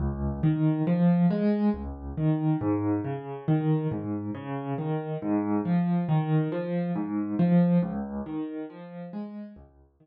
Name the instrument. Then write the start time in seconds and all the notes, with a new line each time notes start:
acoustic grand piano
0.00 C#2
0.43 D#3
0.87 F3
1.30 G#3
1.74 C#2
2.17 D#3
2.61 G#2
3.04 C#3
3.48 D#3
3.91 G#2
4.35 C#3
4.78 D#3
5.22 G#2
5.65 F3
6.09 D#3
6.52 F3
6.95 G#2
7.39 F3
7.83 C#2
8.26 D#3
8.70 F3
9.13 G#3
9.56 C#2
10.00 D#3